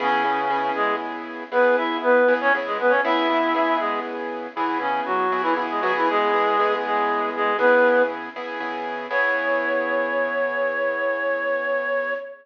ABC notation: X:1
M:12/8
L:1/16
Q:3/8=79
K:C#m
V:1 name="Clarinet"
[C,C]6 [G,G]2 z4 [B,B]2 [Ee]2 [B,B]3 [Cc] z [G,G] [B,B] [Cc] | [Ee]6 [G,G]2 z4 [E,E]2 [C,C]2 [F,F]3 [E,E] z [G,G] [F,F] [E,E] | [G,G]6 [G,G]4 [G,G]2 [B,B]4 z8 | c24 |]
V:2 name="Acoustic Grand Piano"
[C,B,EG]2 [C,B,EG]2 [C,B,EG]8 [C,B,EG]6 [C,B,EG]2 [C,B,EG]4 | [C,B,EG]2 [C,B,EG]2 [C,B,EG]8 [C,B,EG]6 [C,B,EG]2 [C,B,EG]2 [C,B,EG]2- | [C,B,EG]2 [C,B,EG]2 [C,B,EG]8 [C,B,EG]6 [C,B,EG]2 [C,B,EG]4 | [C,B,EG]24 |]